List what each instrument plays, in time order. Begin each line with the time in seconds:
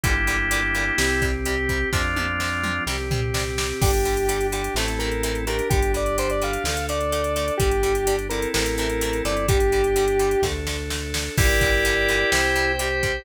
0.04 synth bass 1 G1, acoustic guitar (steel) A#2 D3 G3, drawbar organ A#3 D4 E4 G4, kick, closed hi-hat
0.27 acoustic guitar (steel) A#2 D3 G3, closed hi-hat
0.51 acoustic guitar (steel) A#2 D3 G3, closed hi-hat
0.75 acoustic guitar (steel) A#2 D3 G3, closed hi-hat
0.98 synth bass 1 C2, acoustic guitar (steel) C3 G3, drawbar organ C4 G4, snare
1.22 acoustic guitar (steel) C3 G3, kick, closed hi-hat
1.45 acoustic guitar (steel) C3 G3, drawbar organ G4, closed hi-hat
1.69 acoustic guitar (steel) C3 G3, kick, closed hi-hat
1.92 synth bass 1 F2, acoustic guitar (steel) C3 F3, drawbar organ C4 D4 F4, kick, snare
2.16 acoustic guitar (steel) C3 F3, high tom
2.40 acoustic guitar (steel) C3 F3, snare
2.63 acoustic guitar (steel) C3 F3, mid tom
2.86 synth bass 1 C2, acoustic guitar (steel) C3 G3, drawbar organ C4 G4, snare
3.11 acoustic guitar (steel) C3 G3, floor tom
3.34 acoustic guitar (steel) C3 G3, snare
3.58 acoustic guitar (steel) C3 G3, snare
3.81 synth bass 1 G1, acoustic guitar (steel) D3 G3, drawbar organ D4 G4, lead 1 (square) G4, kick, crash
3.94 closed hi-hat
4.05 acoustic guitar (steel) D3 G3, closed hi-hat
4.17 closed hi-hat
4.29 acoustic guitar (steel) D3 G3, closed hi-hat
4.41 closed hi-hat
4.52 acoustic guitar (steel) D3 G3, lead 1 (square) G4, closed hi-hat
4.64 closed hi-hat
4.74 synth bass 1 A1, acoustic guitar (steel) C3 E3 A3, drawbar organ C4 E4 A4, lead 1 (square) A4, snare
4.88 closed hi-hat
4.99 acoustic guitar (steel) C3 E3 A3, lead 1 (square) A#4, closed hi-hat
5.12 closed hi-hat
5.23 acoustic guitar (steel) C3 E3 A3, closed hi-hat
5.35 closed hi-hat
5.47 acoustic guitar (steel) C3 E3 A3, drawbar organ D4 G4, lead 1 (square) A#4, closed hi-hat
5.59 closed hi-hat
5.70 synth bass 1 G1, acoustic guitar (steel) D3 G3, lead 1 (square) G4, kick, closed hi-hat
5.82 closed hi-hat
5.94 acoustic guitar (steel) D3 G3, lead 1 (square) D5, closed hi-hat
6.06 closed hi-hat
6.18 acoustic guitar (steel) D3 G3, lead 1 (square) C5, closed hi-hat
6.30 lead 1 (square) D5, closed hi-hat
6.42 acoustic guitar (steel) D3 G3, lead 1 (square) F5, closed hi-hat
6.53 closed hi-hat
6.64 synth bass 1 D2, acoustic guitar (steel) D3 A3, drawbar organ D4 A4, snare
6.77 closed hi-hat
6.89 acoustic guitar (steel) D3 A3, lead 1 (square) D5, closed hi-hat
7.01 closed hi-hat
7.12 acoustic guitar (steel) D3 A3, closed hi-hat
7.24 closed hi-hat
7.36 acoustic guitar (steel) D3 A3, closed hi-hat
7.48 closed hi-hat
7.57 synth bass 1 G1, acoustic guitar (steel) D3 G3, drawbar organ D4 G4, lead 1 (square) G4, kick, closed hi-hat
7.71 closed hi-hat
7.83 acoustic guitar (steel) D3 G3, closed hi-hat
7.95 closed hi-hat
8.07 acoustic guitar (steel) D3 G3, closed hi-hat
8.19 closed hi-hat
8.29 acoustic guitar (steel) D3 G3, drawbar organ C4 E4 A4, lead 1 (square) A#4, closed hi-hat
8.42 closed hi-hat
8.54 synth bass 1 A1, acoustic guitar (steel) C3 E3 A3, lead 1 (square) A#4, snare
8.66 closed hi-hat
8.78 acoustic guitar (steel) C3 E3 A3, lead 1 (square) A#4, closed hi-hat
8.90 closed hi-hat
9.01 acoustic guitar (steel) C3 E3 A3, closed hi-hat
9.13 closed hi-hat
9.25 synth bass 1 G1, acoustic guitar (steel) C3 E3 A3, lead 1 (square) D5, closed hi-hat
9.37 closed hi-hat
9.48 acoustic guitar (steel) D3 G3, drawbar organ D4 G4, lead 1 (square) G4, kick, closed hi-hat
9.60 closed hi-hat
9.72 acoustic guitar (steel) D3 G3, closed hi-hat
9.84 closed hi-hat
9.96 acoustic guitar (steel) D3 G3, closed hi-hat
10.08 closed hi-hat
10.19 acoustic guitar (steel) D3 G3, closed hi-hat
10.31 closed hi-hat
10.42 synth bass 1 D2, acoustic guitar (steel) D3 A3, drawbar organ D4 A4, kick, snare
10.67 acoustic guitar (steel) D3 A3, snare
10.90 acoustic guitar (steel) D3 A3, snare
11.14 acoustic guitar (steel) D3 A3, snare
11.38 synth bass 1 G1, acoustic guitar (steel) A#2 D3 G3, drawbar organ E4 G4 A#4 D5 G5, kick, crash
11.61 acoustic guitar (steel) A#2 D3 G3, kick, closed hi-hat
11.85 acoustic guitar (steel) A#2 D3 G3, closed hi-hat
12.08 acoustic guitar (steel) A#2 D3 G3, closed hi-hat
12.32 synth bass 1 C2, acoustic guitar (steel) C3 G3, drawbar organ C5 G5, snare
12.56 acoustic guitar (steel) C3 G3, closed hi-hat
12.79 acoustic guitar (steel) C3 G3, drawbar organ G4, closed hi-hat
13.03 acoustic guitar (steel) C3 G3, kick, closed hi-hat